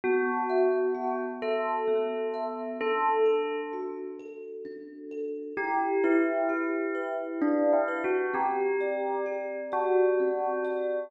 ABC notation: X:1
M:3/4
L:1/8
Q:1/4=65
K:Em
V:1 name="Tubular Bells"
F3 A3 | A2 z4 | G E3 (3D E F | G3 F3 |]
V:2 name="Kalimba"
B, e F e B, e | D A F A D A | E B G B E B | C d G d C d |]